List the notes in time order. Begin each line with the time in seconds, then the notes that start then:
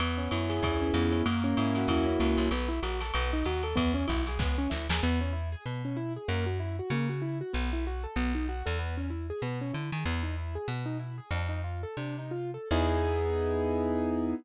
0.00 E2 B3, ride
0.18 C#4
0.31 F#2 E4, hi-hat pedal, ride
0.49 G#4, snare, ride
0.63 E2 E4, kick, ride
0.82 C#4
0.94 F2 B3, hi-hat pedal, ride
1.12 C#4, ride
1.26 F#2 A#3, ride
1.44 C#4
1.57 G#2 E4, hi-hat pedal, ride
1.75 F#4, snare, ride
1.88 E2 E4, kick, ride
2.06 C#4
2.19 C#2 A#3, hi-hat pedal, ride
2.37 C2 C#4, ride
2.51 B1 B3, ride
2.69 E4
2.83 A#1 F#4, hi-hat pedal, ride
3.01 A4, snare, ride
3.14 B1 B3, ride
3.33 D#4
3.45 D#2 F#4, hi-hat pedal, ride
3.63 A4, ride
3.76 E2 B3, kick, ride
3.94 C#4
4.08 B1 E4, kick, hi-hat pedal, ride
4.27 G#4, snare, ride
4.39 C#2 B3, kick, snare
4.58 C#4
4.70 D2 E4, snare
4.89 D#2 G#4, snare
5.03 E2 B3
5.21 C#4
5.33 E4
5.52 G#4
5.66 B2 B3
5.85 C#4
5.97 E4
6.16 G#4
6.28 F#2 A#3
6.46 F#4
6.60 E4
6.79 F#4
6.90 C#3 A#3
7.09 F#4
7.22 E4
7.41 F#4
7.53 B1 B3
7.73 E4
7.87 F#4
8.04 A4
8.16 B1 B3
8.35 D#4
8.49 F#4
8.66 E2 A4
8.79 B3
8.97 C#4
9.10 E4
9.30 G#4
9.42 B2 B3
9.61 C#4
9.73 D3 E4
9.92 D#3 G#4
10.05 E2 B3
10.23 D#4
10.38 E4
10.55 G#4
10.68 B2 B3
10.86 D#4
10.99 E4
11.18 G#4
11.31 F2 D4
11.49 D#4
11.64 F4
11.83 A4
11.97 C3 D4
12.18 D#4
12.31 F4
12.54 A4
12.71 E2 B3 D#4 E4 G#4